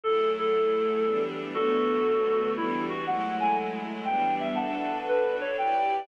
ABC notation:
X:1
M:3/4
L:1/8
Q:"Swing" 1/4=119
K:D
V:1 name="Clarinet"
A A4 z | [FA]4 E F | f ^g z2 =g e | [fa]2 B c g2 |]
V:2 name="String Ensemble 1"
[F,A,E^G]4 [E,=G,B,D]2 | [D,F,A,B,]4 [E,G,B,D]2 | [F,^G,A,E]4 [E,=G,B,D]2 | [DFAB]4 [EGBd]2 |]